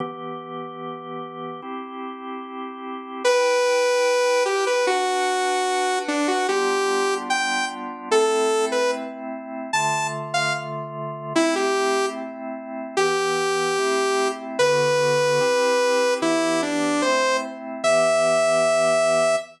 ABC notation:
X:1
M:2/4
L:1/16
Q:1/4=74
K:Em
V:1 name="Lead 2 (sawtooth)"
z8 | z8 | B6 G B | F6 D F |
G4 g2 z2 | [K:Am] A3 B z4 | a2 z f z4 | E G3 z4 |
[K:Em] G8 | B8 | E2 D2 c2 z2 | e8 |]
V:2 name="Drawbar Organ"
[E,B,G]8 | [CEG]8 | [EBg]8 | [DBf]8 |
[G,B,D=F]8 | [K:Am] [A,CE]8 | [D,A,F]8 | [A,CE]8 |
[K:Em] [E,B,G]4 [A,CE]4 | [D,B,F]4 [CEG]4 | [E,B,G]4 [A,CE]4 | [E,B,G]8 |]